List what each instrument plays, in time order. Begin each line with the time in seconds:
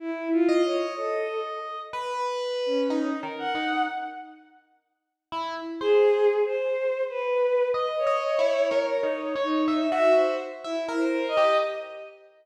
0.00 violin E4
0.32 violin F4
0.49 electric piano 1 D#5
0.65 violin C#5
0.97 violin A4
1.93 electric piano 1 B4
2.66 violin C#4
2.90 electric piano 1 D#4
3.23 electric piano 1 A#4
3.39 violin F#5
3.55 electric piano 1 D#4
5.32 electric piano 1 E4
5.80 violin G#4, electric piano 1 C5
6.45 violin C5
7.10 violin B4
7.74 electric piano 1 D#5
7.98 violin C#5
8.07 electric piano 1 D#5
8.39 electric piano 1 E4
8.71 electric piano 1 A#4
8.96 violin C#5
9.03 electric piano 1 D#4
9.35 electric piano 1 C#5
9.43 violin D#4
9.68 electric piano 1 E5
9.92 electric piano 1 F#4, violin E5
10.15 violin C5
10.64 violin E4, electric piano 1 E5
10.89 electric piano 1 A#4
10.97 violin C5
11.28 violin D#5
11.37 electric piano 1 G4